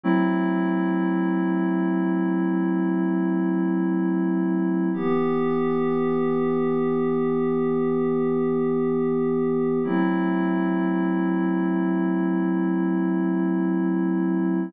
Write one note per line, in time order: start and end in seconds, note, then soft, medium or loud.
0.04 4.89 F#3 medium
0.04 4.89 A3 medium
0.04 4.89 C4 medium
0.04 4.89 E4 medium
4.93 9.79 E3 medium
4.93 9.79 B3 medium
4.93 9.79 G4 medium
9.83 14.69 F#3 medium
9.83 14.69 A3 medium
9.83 14.69 C4 medium
9.83 14.69 E4 medium